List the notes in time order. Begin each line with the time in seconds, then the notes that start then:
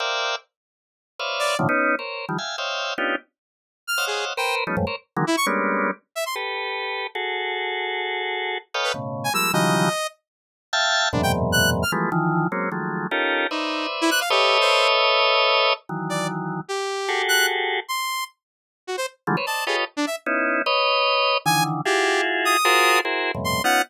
0.00 A#4 C5 D5 E5 F5 G5
1.19 B4 C5 C#5 D5 E5 F5
1.39 D5
1.59 A2 A#2 C3 D3 D#3 F3
1.69 B3 C#4 D#4
1.99 A#4 C5 C#5
2.29 D#3 F3 G3
2.38 E5 F5 G5 G#5
2.58 C5 C#5 D#5 E5 F5 G5
2.98 B3 C#4 D4 D#4 F4 G4
3.87 F6
3.98 C5 C#5 D#5 F5 F#5
4.07 G#4
4.37 A#4 B4 C5 G5
4.67 F3 G3 A3 B3 C#4 D#4
4.77 F2 G2 G#2 A2
4.87 A#4 C5 C#5
5.16 D3 D#3 E3 F#3 G#3 A#3
5.27 E4
5.37 C#6
5.46 G3 G#3 A#3 B3 C#4 D4
6.15 E5
6.26 C6
6.36 G4 A4 B4
7.15 F#4 G#4 A4
8.74 A4 B4 C#5 D#5 F5 G5
8.84 B4
8.94 A2 B2 C#3
9.24 G#5
9.34 F3 G3 G#3 A#3 E6
9.53 C#3 D#3 E3 F3 F#3 G3 D#5
10.73 E5 F5 G5 A5
11.13 E2 F#2 G#2 A#2 B2 C3 D4
11.23 G5
11.52 F#6
11.82 F6
11.92 E3 F3 G3 G#3 A3 B3
12.12 D#3 E3 F3
12.52 F#3 G#3 A#3 C4 C#4
12.72 D#3 F3 F#3 G#3 A3
13.11 C#4 D#4 F4 G4 A4 A#4
13.51 D#4 B4 C5 D5 E5
14.01 E4
14.11 F#6
14.21 F5
14.30 G4 A4 B4 C#5 D#5 E5
14.61 C5
15.89 D#3 E3 F#3
16.10 D5
16.68 G4
17.09 F#4 G4 G#4 A4
17.28 F#6
17.88 C6
18.87 F#4
18.97 C5
19.27 D3 E3 F3 G3 G#3 A3
19.37 B4 C5 C#5
19.46 C5 D5 D#5 A5
19.67 F4 G4 G#4 A4 B4 C#5 D#5
19.97 D4
20.07 E5
20.26 B3 C#4 D#4 E4
20.66 B4 C#5 D#5
21.46 D3 D#3 E3 G#5
21.85 E4 F4 F#4 G4 G#4
22.45 D#6
22.65 F4 F#4 G#4 A#4 C5
23.05 E4 F#4 G#4 A#4 C5
23.35 F2 G2 A2 B2 C3
23.44 C6
23.64 B3 C#4 D#4 F4 F#5